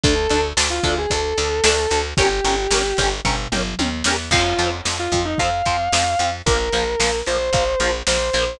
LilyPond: <<
  \new Staff \with { instrumentName = "Distortion Guitar" } { \time 4/4 \key f \minor \tempo 4 = 112 a'8. r8 f'8 gis'16 a'2 | g'2 r2 | f'8. r8 f'8 ees'16 f''2 | bes'4. c''4. c''4 | }
  \new Staff \with { instrumentName = "Overdriven Guitar" } { \time 4/4 \key f \minor <d' a'>8 <d' a'>8 <d' a'>8 <d' a'>8 <d' a'>8 <d' a'>8 <d' a'>8 <d' a'>8 | <des' g' bes'>8 <des' g' bes'>8 <des' g' bes'>8 <des' g' bes'>8 <des' g' bes'>8 <des' g' bes'>8 <des' g' bes'>8 <des' g' bes'>8 | <f c'>8 <f c'>8 <f c'>8 <f c'>8 <f c'>8 <f c'>8 <f c'>8 <f c'>8 | <f bes>8 <f bes>8 <f bes>8 <f bes>8 <f bes>8 <f bes>8 <f bes>8 <f bes>8 | }
  \new Staff \with { instrumentName = "Electric Bass (finger)" } { \clef bass \time 4/4 \key f \minor d,8 d,8 d,8 d,8 d,8 d,8 d,8 d,8 | g,,8 g,,8 g,,8 g,,8 g,,8 g,,8 ees,8 e,8 | f,8 f,8 f,8 f,8 f,8 f,8 f,8 f,8 | bes,,8 bes,,8 bes,,8 bes,,8 bes,,8 bes,,8 bes,,8 bes,,8 | }
  \new DrumStaff \with { instrumentName = "Drums" } \drummode { \time 4/4 <hh bd>8 hh8 sn8 <hh bd>8 <hh bd>8 hh8 sn8 hh8 | <hh bd>8 hh8 sn8 <hh bd>8 <bd tomfh>8 toml8 tommh8 sn8 | <cymc bd>8 hh8 sn8 <hh bd>8 <hh bd>8 <hh bd>8 sn8 hh8 | <hh bd>8 hh8 sn8 hh8 <hh bd>8 hh8 sn8 hh8 | }
>>